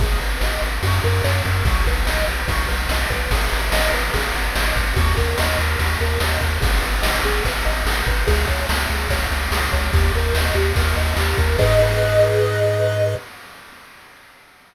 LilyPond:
<<
  \new Staff \with { instrumentName = "Lead 1 (square)" } { \time 4/4 \key gis \minor \tempo 4 = 145 gis'8 b'8 dis''8 b'8 fis'8 ais'8 cis''8 ais'8 | fis'8 b'8 dis''8 b'8 fis'8 b'8 dis''8 b'8 | gis'8 b'8 dis''8 b'8 gis'8 b'8 dis''8 b'8 | fis'8 ais'8 dis''8 ais'8 fis'8 ais'8 dis''8 ais'8 |
gis'8 b'8 dis''8 gis'8 b'8 dis''8 gis'8 b'8 | gis'8 cis''8 e''8 gis'8 cis''8 e''8 gis'8 cis''8 | g'8 ais'8 dis''8 g'8 ais'8 dis''8 g'8 ais'8 | <gis' b' dis''>1 | }
  \new Staff \with { instrumentName = "Synth Bass 1" } { \clef bass \time 4/4 \key gis \minor gis,,8 gis,,8 gis,,8 gis,,8 fis,8 fis,8 fis,8 fis,8 | b,,8 b,,8 b,,8 b,,8 b,,8 b,,8 b,,8 b,,8 | gis,,8 gis,,8 gis,,8 gis,,8 gis,,8 gis,,8 gis,,8 gis,,8 | dis,8 dis,8 dis,8 dis,8 dis,8 dis,8 dis,8 dis,8 |
gis,,8 gis,,8 gis,,8 gis,,8 gis,,8 gis,,8 gis,,8 gis,,8 | cis,8 cis,8 cis,8 cis,8 cis,8 cis,8 cis,8 cis,8 | dis,8 dis,8 dis,8 dis,8 dis,8 dis,8 dis,8 dis,8 | gis,1 | }
  \new DrumStaff \with { instrumentName = "Drums" } \drummode { \time 4/4 <bd cymr>8 cymr8 sn8 cymr8 <bd cymr>8 cymr8 sn8 <bd cymr>8 | <bd cymr>8 <bd cymr>8 sn8 cymr8 <bd cymr>8 cymr8 sn8 <bd cymr>8 | <bd cymr>8 cymr8 sn8 cymr8 <bd cymr>8 cymr8 sn8 <bd cymr>8 | <bd cymr>8 <bd cymr>8 sn8 cymr8 <bd cymr>8 cymr8 sn8 <bd cymr>8 |
<bd cymr>8 cymr8 sn8 cymr8 <bd cymr>8 cymr8 sn8 <bd cymr>8 | <bd cymr>8 <bd cymr>8 sn8 cymr8 <bd cymr>8 cymr8 sn8 <bd cymr>8 | <bd cymr>8 cymr8 sn8 cymr8 <bd cymr>8 cymr8 sn8 <bd cymr>8 | <cymc bd>4 r4 r4 r4 | }
>>